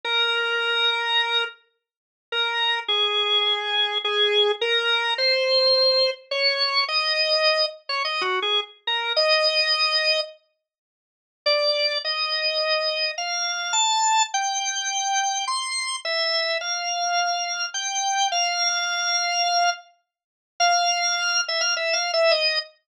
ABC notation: X:1
M:4/4
L:1/16
Q:1/4=105
K:Bb
V:1 name="Drawbar Organ"
B10 z6 | [K:Bbm] B4 A8 A4 | B4 c8 d4 | e6 z d (3e2 G2 A2 z2 B2 |
e8 z8 | [K:Bb] d4 e8 f4 | a4 g8 c'4 | _f4 =f8 g4 |
f10 z6 | [K:F] f6 e f (3e2 f2 e2 _e2 z2 |]